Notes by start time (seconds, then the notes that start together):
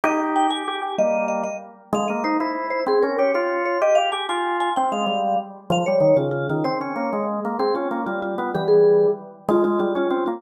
0.04 D#4 G4 D#5
0.36 G5
0.50 G4 G#5
0.68 G4
0.82 G4
0.98 G3 A#3 D#5
1.28 D#5
1.43 D#5
1.93 G#3 F5
2.08 A#3 D#5
2.24 D#4 C5
2.40 E4 C5
2.70 C5
2.86 C4 G#4
3.02 C#4 A#4
3.18 G4 C#5
3.34 F4 C#5
3.65 C#5
3.81 G4 D#5
3.95 G4 F5
4.12 G4 G#5
4.29 F4 G#5
4.60 G#5
4.76 C4 G5
4.92 G#3 F5
5.06 G3
5.70 F3 F5
5.86 G3 C#5
6.00 D#3
6.17 C#3 F4
6.31 F4
6.49 D#3 F4
6.64 C4 C5
6.81 C#4 C#5
6.96 A#3
7.13 G#3
7.45 A#3
7.59 C4 G#4
7.75 C#4 F4
7.91 A#3
8.06 G3 F4
8.22 F4
8.38 B3 F4
8.54 E3 G3 G4
8.68 G#4
9.49 G#3 F4
9.64 G#3 F4
9.79 G3 F4
9.95 C#4 F4
10.10 C4 F4
10.26 A#3 F4